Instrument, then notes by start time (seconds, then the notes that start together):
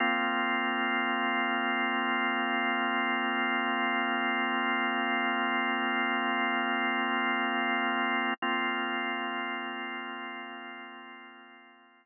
drawbar organ
0.00 A#3 C4 F4
8.42 A#3 C4 F4